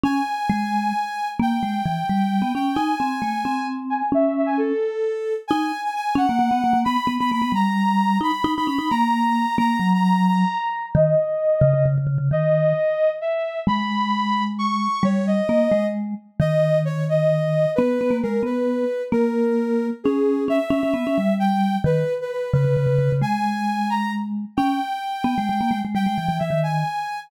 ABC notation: X:1
M:6/8
L:1/16
Q:3/8=88
K:C#m
V:1 name="Ocarina"
g12 | =g10 g2 | g10 g2 | e2 e g A8 |
[K:G#m] g3 g g2 f6 | b3 b b2 a6 | b3 b b2 a6 | a3 a a2 a6 |
d8 z4 | d8 e4 | b8 c'4 | c2 d6 z4 |
d4 c2 d6 | B4 A2 B6 | A8 G4 | e8 =g4 |
B3 B B2 B6 | g6 a2 z4 | =g12 | =g4 e2 ^g6 |]
V:2 name="Vibraphone"
C2 z2 G,4 z4 | ^A,2 G,2 E,2 =G,3 B, C2 | D2 ^B,2 A,2 B,6 | C6 z6 |
[K:G#m] D2 z4 C A, A, B, A, A, | B, z B, B, A, B, =G,6 | D z D D C D A,6 | A,2 F,6 z4 |
D,2 z4 C, C, C, C, C, C, | D,4 z8 | G,12 | =G,4 A,2 ^G,4 z2 |
D,12 | B,2 B, A, G,2 B,4 z2 | A,8 C4 | C z C C B, C =G,6 |
D,2 z4 C, C, C, C, C, C, | G,12 | C2 z4 B, G, G, A, G, G, | =G, ^G, E, E, E, D,3 z4 |]